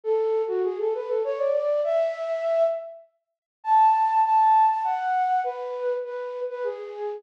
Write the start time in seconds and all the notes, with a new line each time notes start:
0.04 A4
0.48 F#4
0.64 G#4
0.79 A4
0.94 B4
1.08 A4
1.24 C#5
1.38 D5
1.53 D5
1.84 E5
3.64 A5
4.24 A5
4.69 A5
4.84 F#5
5.44 B4
6.04 B4
6.49 B4
6.64 G#4